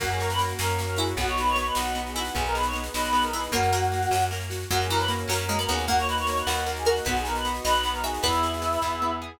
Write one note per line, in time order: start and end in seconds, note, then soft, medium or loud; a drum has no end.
0.00 0.54 F#2 loud
0.00 0.38 A#3 medium
0.00 1.17 A#3 medium
0.00 1.17 C#4 medium
0.00 0.09 F#4 loud
0.00 1.17 F#4 medium
0.00 0.09 F#5 loud
0.00 kick loud
0.00 snare loud
0.00 crash loud
0.11 0.21 G#4 medium
0.11 0.21 G#5 medium
0.11 snare medium
0.20 0.97 F#4 medium
0.20 0.30 A#4 medium
0.20 0.30 A#5 loud
0.20 snare loud
0.30 0.39 B4 medium
0.30 0.39 B5 medium
0.30 snare loud
0.38 0.79 A#3 medium
0.38 snare loud
0.49 snare medium
0.59 1.14 F#2 loud
0.59 1.16 C#4 medium
0.59 0.84 A#4 medium
0.59 0.84 A#5 medium
0.59 snare loud
0.70 snare medium
0.79 1.17 A#3 medium
0.79 snare loud
0.87 0.97 A#4 medium
0.87 0.97 A#5 loud
0.87 snare medium
0.96 1.14 E4 loud
0.96 1.16 F#4 medium
0.96 1.15 G#4 medium
0.96 1.15 G#5 medium
0.96 snare loud
1.07 snare medium
1.17 1.71 B1 loud
1.17 1.55 B3 medium
1.17 2.35 B3 medium
1.17 2.35 D#4 medium
1.17 2.35 F#4 medium
1.17 1.29 F#4 medium
1.17 1.29 F#5 loud
1.17 kick loud
1.17 snare loud
1.27 1.38 C#5 medium
1.27 1.38 C#6 medium
1.27 snare medium
1.38 2.17 F#4 medium
1.38 1.48 B4 medium
1.38 1.48 B5 medium
1.38 snare loud
1.47 1.56 C#5 medium
1.47 1.56 C#6 loud
1.47 snare medium
1.56 1.94 B3 medium
1.56 1.66 C#5 medium
1.56 1.66 C#6 medium
1.56 snare loud
1.66 1.75 B4 medium
1.66 1.75 B5 medium
1.66 snare medium
1.75 2.30 B1 medium
1.75 2.33 D#4 medium
1.75 2.01 F#4 medium
1.75 2.01 F#5 medium
1.75 snare loud
1.86 snare medium
1.95 2.32 B3 medium
1.95 snare medium
2.07 2.16 G#4 medium
2.07 2.16 G#5 medium
2.07 snare medium
2.16 2.33 E4 loud
2.16 2.35 F#4 medium
2.16 2.36 F#4 medium
2.16 2.35 F#5 medium
2.16 snare loud
2.25 snare loud
2.35 2.90 B1 loud
2.35 2.73 B3 medium
2.35 3.52 B3 medium
2.35 3.52 D#4 medium
2.35 2.44 G#4 loud
2.35 3.52 G#4 medium
2.35 2.44 G#5 loud
2.35 kick loud
2.35 snare medium
2.45 2.55 A#4 medium
2.45 2.55 A#5 medium
2.45 snare medium
2.55 3.34 G#4 medium
2.55 2.65 B4 medium
2.55 2.65 B5 loud
2.55 snare loud
2.63 2.75 C#5 medium
2.63 2.75 C#6 medium
2.63 snare medium
2.73 3.12 B3 medium
2.73 snare medium
2.84 snare loud
2.94 3.49 B1 medium
2.94 3.50 D#4 medium
2.94 3.23 B4 medium
2.94 3.23 B5 medium
2.94 snare loud
3.04 snare loud
3.13 3.50 B3 medium
3.13 snare medium
3.22 3.32 A#4 medium
3.22 3.32 A#5 loud
3.22 snare medium
3.33 3.50 E4 loud
3.33 3.54 G#4 medium
3.33 3.50 B4 medium
3.33 3.50 B5 medium
3.33 snare loud
3.43 snare medium
3.52 4.06 F#2 loud
3.52 3.71 A#3 loud
3.52 3.91 A#3 medium
3.52 4.25 F#4 loud
3.52 4.25 F#5 loud
3.52 kick loud
3.52 snare medium
3.63 snare medium
3.73 4.04 A#3 loud
3.73 4.50 F#4 medium
3.73 snare loud
3.83 snare medium
3.92 4.30 A#3 medium
3.92 snare medium
4.02 snare medium
4.11 4.65 F#2 medium
4.11 4.68 C#4 medium
4.11 snare loud
4.21 snare medium
4.31 4.68 A#3 medium
4.31 snare loud
4.41 snare medium
4.50 4.69 F#4 medium
4.50 snare loud
4.60 snare medium
4.71 5.25 F#2 loud
4.71 4.87 F#3 loud
4.71 5.08 A#3 medium
4.71 5.88 A#3 medium
4.71 5.88 C#4 medium
4.71 4.80 F#4 loud
4.71 5.88 F#4 medium
4.71 4.80 F#5 loud
4.71 kick loud
4.71 snare medium
4.80 4.90 G#4 medium
4.80 4.90 G#5 medium
4.80 snare medium
4.89 5.24 E3 loud
4.89 5.69 F#4 medium
4.89 4.99 A#4 medium
4.89 4.99 A#5 medium
4.89 snare medium
4.99 5.08 B4 medium
4.99 5.08 B5 loud
4.99 snare medium
5.08 5.48 A#3 medium
5.08 snare loud
5.19 snare medium
5.28 5.66 F#2 medium
5.28 5.46 F#3 loud
5.28 5.83 C#4 medium
5.28 5.57 A#4 medium
5.28 5.57 A#5 medium
5.28 snare loud
5.38 snare medium
5.49 5.58 G#3 loud
5.49 5.86 A#3 medium
5.49 snare medium
5.59 5.68 B3 medium
5.59 5.69 A#4 medium
5.59 5.69 A#5 medium
5.59 snare medium
5.68 6.43 D#2 loud
5.68 5.86 B3 loud
5.68 5.88 F#4 medium
5.68 5.85 G#4 medium
5.68 5.85 G#5 medium
5.68 snare medium
5.78 snare medium
5.88 6.24 A#3 loud
5.88 7.06 A#3 medium
5.88 6.26 A#3 medium
5.88 7.06 D#4 medium
5.88 5.98 F#4 loud
5.88 7.06 F#4 medium
5.88 5.98 F#5 loud
5.88 kick loud
5.88 snare loud
5.98 6.07 C#5 medium
5.98 6.07 C#6 medium
5.98 snare medium
6.08 6.86 F#4 medium
6.08 6.17 B4 medium
6.08 6.17 B5 loud
6.08 snare loud
6.17 6.27 C#5 medium
6.17 6.27 C#6 medium
6.17 snare medium
6.27 6.66 A#3 medium
6.27 6.37 C#5 medium
6.27 6.37 C#6 loud
6.27 snare loud
6.37 6.48 B4 medium
6.37 6.48 B5 medium
6.37 snare medium
6.47 7.01 D#2 loud
6.47 7.04 D#4 medium
6.47 6.83 F#4 loud
6.47 6.72 F#4 medium
6.47 6.72 F#5 loud
6.47 snare loud
6.58 snare medium
6.66 7.04 A#3 medium
6.66 snare medium
6.76 6.87 G#4 medium
6.76 6.87 G#5 medium
6.76 snare medium
6.85 7.05 F#4 medium
6.85 7.03 F#4 medium
6.85 7.05 A#4 loud
6.85 7.03 F#5 loud
6.85 snare loud
6.96 snare medium
7.05 7.60 B1 loud
7.05 7.44 B3 medium
7.05 8.23 B3 medium
7.05 8.23 D#4 medium
7.05 7.16 F#4 medium
7.05 8.23 F#4 medium
7.05 7.42 B4 loud
7.05 7.16 F#5 loud
7.05 kick loud
7.05 snare loud
7.16 7.25 G#4 medium
7.16 7.25 G#5 loud
7.16 snare medium
7.25 8.03 F#4 medium
7.25 7.35 A#4 medium
7.25 7.35 A#5 loud
7.25 snare loud
7.35 7.44 B4 medium
7.35 7.44 B5 loud
7.35 snare medium
7.45 7.84 B3 medium
7.45 snare loud
7.55 snare medium
7.64 8.19 B1 loud
7.64 8.20 D#4 medium
7.64 7.89 B4 loud
7.64 8.00 D#5 loud
7.64 7.89 B5 loud
7.64 snare loud
7.75 snare medium
7.83 8.22 B3 medium
7.83 snare loud
7.93 8.02 A#4 medium
7.93 8.02 A#5 medium
7.93 snare medium
8.03 8.22 F#4 medium
8.03 8.20 G#4 medium
8.03 8.22 E5 loud
8.03 8.20 G#5 medium
8.03 snare loud
8.14 snare medium
8.23 8.78 E2 loud
8.23 8.61 B3 medium
8.23 9.39 B3 medium
8.23 9.12 E4 loud
8.23 9.39 E4 medium
8.23 9.39 G#4 medium
8.23 8.58 B4 loud
8.23 9.12 E5 loud
8.23 kick loud
8.23 snare loud
8.33 snare medium
8.43 9.21 G#4 medium
8.43 snare medium
8.54 snare medium
8.62 9.01 B3 medium
8.62 snare medium
8.73 snare medium
8.82 9.36 E2 medium
8.82 9.38 E4 medium
8.82 kick medium
8.82 snare medium
9.02 9.39 B3 medium
9.22 9.39 G#4 medium